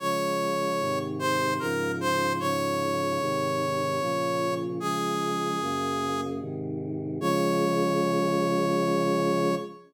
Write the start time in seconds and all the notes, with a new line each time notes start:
0.00 C#3 F3 G#3 C#5
0.80 G#2 C3 D#3
1.19 C5
1.59 G#2 C#3 F3 A#4
2.01 C5
2.39 G#2 C#3 F3 C#5
3.20 G#2 C3 D#3
4.00 A#2 C#3 F3
4.80 C#3 F3 G#3 G#4
5.60 F#2 C#3 A#3
6.40 G#2 C3 D#3
7.20 C#3 F3 G#3 C#5